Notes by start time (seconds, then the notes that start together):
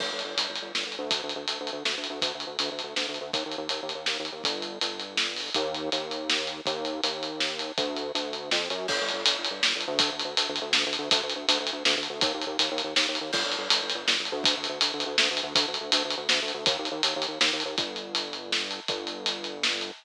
0.00 G1, kick, crash
0.12 G1
0.19 closed hi-hat
0.25 G1
0.37 G1, closed hi-hat
0.49 G1
0.56 closed hi-hat
0.62 G1
0.74 G1, snare
0.86 G1
0.92 closed hi-hat
0.99 D2
1.11 kick, closed hi-hat
1.23 D2
1.29 closed hi-hat
1.36 D2
1.48 D2, closed hi-hat
1.60 D2
1.67 closed hi-hat
1.73 D2
1.85 D2, snare
1.98 D2
2.04 closed hi-hat
2.10 D2
2.22 D2, kick, closed hi-hat
2.35 D2
2.40 closed hi-hat
2.47 D2
2.59 D2, closed hi-hat
2.72 D2
2.79 closed hi-hat
2.84 D2
2.96 D2, snare
3.09 D2
3.14 closed hi-hat
3.21 D2
3.33 D#2, kick, closed hi-hat
3.46 D#2
3.52 closed hi-hat
3.58 D#2
3.69 D#2, closed hi-hat
3.83 D#2
3.89 closed hi-hat
3.95 D#2
4.06 D#2, snare
4.20 D#2
4.25 closed hi-hat
4.32 D#2
4.44 G1, kick, closed hi-hat
4.62 closed hi-hat
4.81 G1, closed hi-hat
5.00 closed hi-hat
5.17 snare
5.36 open hi-hat
5.54 D#2, kick, closed hi-hat
5.74 closed hi-hat
5.92 D#2, closed hi-hat
6.11 closed hi-hat
6.30 snare
6.47 closed hi-hat
6.66 D#2, kick, closed hi-hat
6.85 closed hi-hat
7.04 D#2, closed hi-hat
7.23 closed hi-hat
7.40 snare
7.59 closed hi-hat
7.78 D2, kick, closed hi-hat
7.97 closed hi-hat
8.15 D2, closed hi-hat
8.33 closed hi-hat
8.51 F2, snare
8.70 F#2, closed hi-hat
8.88 G1, kick, crash
9.01 G1
9.09 closed hi-hat
9.14 G1
9.26 G1, closed hi-hat
9.38 G1
9.45 closed hi-hat
9.51 G1
9.63 G1, snare
9.75 G1
9.81 closed hi-hat
9.88 D2
9.99 kick, closed hi-hat
10.12 D2
10.19 closed hi-hat
10.25 D2
10.37 D2, closed hi-hat
10.49 D2
10.56 closed hi-hat
10.62 D2
10.73 D2, snare
10.86 D2
10.93 closed hi-hat
10.99 D2
11.11 D2, kick, closed hi-hat
11.23 D2
11.30 closed hi-hat
11.36 D2
11.48 D2, closed hi-hat
11.60 D2
11.67 closed hi-hat
11.73 D2
11.85 D2, snare
11.97 D2
12.03 closed hi-hat
12.10 D2
12.21 D#2, kick, closed hi-hat
12.34 D#2
12.42 closed hi-hat
12.47 D#2
12.59 D#2, closed hi-hat
12.72 D#2
12.78 closed hi-hat
12.84 D#2
12.96 D#2, snare
13.09 D#2
13.15 closed hi-hat
13.21 D#2
13.33 G1, kick, crash
13.46 G1
13.52 closed hi-hat
13.58 G1
13.70 G1, closed hi-hat
13.83 G1
13.90 closed hi-hat
13.95 G1
14.07 G1, snare
14.20 G1
14.25 closed hi-hat
14.32 D2
14.44 kick, closed hi-hat
14.57 D2
14.64 closed hi-hat
14.69 D2
14.81 D2, closed hi-hat
14.94 D2
15.00 closed hi-hat
15.06 D2
15.18 D2, snare
15.31 D2
15.37 closed hi-hat
15.43 D2
15.55 D2, kick, closed hi-hat
15.68 D2
15.74 closed hi-hat
15.80 D2
15.92 D2, closed hi-hat
16.05 D2
16.10 closed hi-hat
16.17 D2
16.29 D2, snare
16.42 D2
16.48 closed hi-hat
16.54 D2
16.66 D#2, kick, closed hi-hat
16.79 D#2
16.85 closed hi-hat
16.91 D#2
17.03 D#2, closed hi-hat
17.16 D#2
17.22 closed hi-hat
17.28 D#2
17.41 D#2, snare
17.53 D#2
17.60 closed hi-hat
17.65 D#2
17.78 G1, kick, closed hi-hat
17.96 closed hi-hat
18.15 closed hi-hat
18.33 closed hi-hat
18.52 snare
18.71 closed hi-hat
18.88 G1, kick, closed hi-hat
19.07 closed hi-hat
19.26 closed hi-hat
19.44 closed hi-hat
19.63 snare
19.81 closed hi-hat